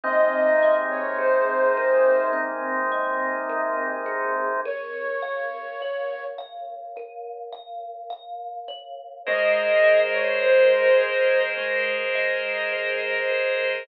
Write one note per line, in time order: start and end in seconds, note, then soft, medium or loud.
0.04 4.61 C3 medium
0.04 4.61 G#3 medium
0.04 4.61 A#3 medium
0.04 2.32 C4 medium
0.04 4.61 D#4 medium
0.04 0.74 D#5 loud
0.63 2.91 D#5 medium
0.90 1.17 C#5 medium
1.19 4.06 G#4 medium
1.19 2.26 C5 loud
1.77 3.49 A#4 medium
2.33 4.52 C4 medium
2.92 4.56 D#5 medium
3.50 4.59 A#4 medium
4.06 4.61 G#4 medium
4.66 6.96 A#4 medium
4.66 6.24 C#5 loud
5.22 6.38 F5 medium
5.82 8.68 C#5 medium
6.38 7.52 F5 medium
6.97 9.16 A#4 medium
7.53 8.10 F5 medium
8.10 9.20 F5 medium
8.68 9.23 C#5 medium
9.26 11.57 G#3 loud
9.26 13.83 G#4 medium
9.26 13.83 A#4 medium
9.26 13.83 C5 medium
9.26 13.83 D#5 medium
9.26 9.99 D#5 loud
9.84 12.15 D#5 medium
10.13 10.41 C#5 loud
10.43 13.30 A#4 medium
10.43 11.50 C5 loud
11.01 12.72 C5 medium
11.57 13.77 G#3 medium
12.15 13.80 D#5 medium
12.72 13.82 C5 medium
13.30 13.85 A#4 medium